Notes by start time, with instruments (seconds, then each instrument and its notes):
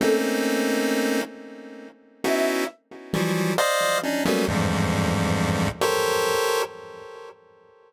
0.00 lead 1 (square) A3 A#3 C4 C#4 D#4, flute A4
2.24 lead 1 (square) B3 C#4 D#4 E4 F#4, flute E5
3.13 lead 1 (square) E3 F3 F#3 G3
3.58 lead 1 (square) C5 D5 D#5 F5
4.03 lead 1 (square) C#4 D4 D#4
4.25 lead 1 (square) F#3 G3 A3 A#3 B3 C#4
4.48 lead 1 (square) E2 F2 G2 G#2
5.81 lead 1 (square) G4 A4 A#4 C5 C#5